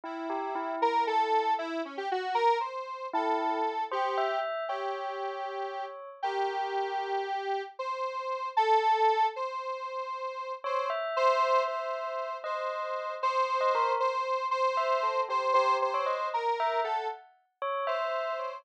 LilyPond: <<
  \new Staff \with { instrumentName = "Lead 1 (square)" } { \time 6/8 \tempo 4. = 77 e'4. ais'8 a'4 | e'8 cis'16 g'16 fis'8 ais'8 c''4 | a'4. g'4 r8 | g'2~ g'8 r8 |
g'2. | c''4. a'4. | c''2~ c''8 c''8 | r8 c''4 c''4. |
c''4. c''4. | c''4 c''4. c''8 | c''8 c''4 ais'4 a'8 | r4. c''4. | }
  \new Staff \with { instrumentName = "Tubular Bells" } { \time 6/8 e'8 g'8 e'8 e'4. | r2. | e'4 r8 c''8 e''4 | cis''2. |
ais'2 r4 | r2. | r2 r8 cis''8 | e''2. |
dis''4. c''8. dis''16 ais'8 | r4. e''8 a'8 g'8 | g'8. cis''16 dis''8 r8 e''8 fis''8 | r4 cis''8 e''4 cis''8 | }
>>